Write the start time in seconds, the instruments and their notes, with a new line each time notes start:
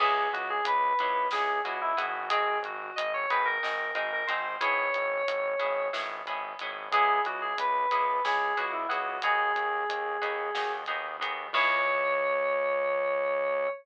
0.00 synth bass 1 C#2, pizzicato strings B3 C#4 E4 G#4, electric piano 2 G#4, kick, crash
0.32 synth bass 1 C#2, electric piano 2 F#4, closed hi-hat
0.50 electric piano 2 G#4
0.65 synth bass 1 C#2, electric piano 2 B4, closed hi-hat
0.99 synth bass 1 C#2, pizzicato strings B3 C#4 E4 G#4, closed hi-hat
1.31 synth bass 1 C#2, pizzicato strings B3 C#4 E4 G#4, electric piano 2 G#4, snare
1.64 synth bass 1 C#2, pizzicato strings B3 C#4 E4 G#4, electric piano 2 F#4, closed hi-hat
1.81 electric piano 2 E4
1.97 synth bass 1 G#1, pizzicato strings B3 C#4 E4 G#4, electric piano 2 F#4, closed hi-hat
2.30 pizzicato strings C4 D#4 F#4 G#4, electric piano 2 G#4, kick, closed hi-hat
2.63 synth bass 1 G#1, electric piano 2 F#4, closed hi-hat
2.96 synth bass 1 G#1, electric piano 2 D#5, closed hi-hat
3.14 electric piano 2 C#5
3.30 synth bass 1 G#1, pizzicato strings C4 D#4 F#4 G#4, electric piano 2 B4, closed hi-hat
3.45 electric piano 2 A#4
3.63 synth bass 1 G#1, pizzicato strings C4 D#4 F#4 G#4, snare
3.94 synth bass 1 G#1, pizzicato strings C4 D#4 F#4 G#4, electric piano 2 A#4, closed hi-hat
4.13 electric piano 2 A#4
4.27 synth bass 1 G#1, pizzicato strings C4 D#4 F#4 G#4, electric piano 2 C5, closed hi-hat
4.61 synth bass 1 G#1, pizzicato strings B3 C#4 E4 G#4, electric piano 2 C#5, kick, closed hi-hat
4.94 synth bass 1 G#1, closed hi-hat
5.27 synth bass 1 G#1, closed hi-hat
5.59 synth bass 1 G#1, pizzicato strings B3 C#4 E4 G#4, closed hi-hat
5.93 synth bass 1 G#1, pizzicato strings B3 C#4 E4 G#4, snare
6.26 synth bass 1 G#1, pizzicato strings B3 C#4 E4 G#4, closed hi-hat
6.59 synth bass 1 G#1, pizzicato strings B3 C#4 E4 G#4, closed hi-hat
6.91 synth bass 1 C#2, pizzicato strings B3 C#4 E4 G#4, electric piano 2 G#4, kick, closed hi-hat
7.25 synth bass 1 C#2, electric piano 2 F#4, closed hi-hat
7.41 electric piano 2 G#4
7.58 synth bass 1 C#2, electric piano 2 B4, closed hi-hat
7.91 synth bass 1 C#2, pizzicato strings B3 C#4 E4 G#4, closed hi-hat
8.25 synth bass 1 C#2, pizzicato strings B3 C#4 E4 G#4, electric piano 2 G#4, snare
8.57 synth bass 1 C#2, pizzicato strings B3 C#4 E4 G#4, electric piano 2 F#4, closed hi-hat
8.72 electric piano 2 E4
8.89 synth bass 1 C#2, pizzicato strings B3 C#4 E4 G#4, electric piano 2 F#4, closed hi-hat
9.22 synth bass 1 D#2, pizzicato strings B3 D#4 F#4 G#4, electric piano 2 G#4, kick, closed hi-hat
9.55 synth bass 1 D#2, closed hi-hat
9.89 synth bass 1 D#2, closed hi-hat
10.21 synth bass 1 D#2, pizzicato strings B3 D#4 F#4 G#4, closed hi-hat
10.55 synth bass 1 D#2, pizzicato strings B3 D#4 F#4 G#4, snare
10.86 synth bass 1 D#2, pizzicato strings B3 D#4 F#4 G#4, closed hi-hat
11.19 synth bass 1 D#2, pizzicato strings B3 D#4 F#4 G#4, closed hi-hat
11.53 synth bass 1 C#2, pizzicato strings B3 C#4 E4 G#4, electric piano 2 C#5, kick, crash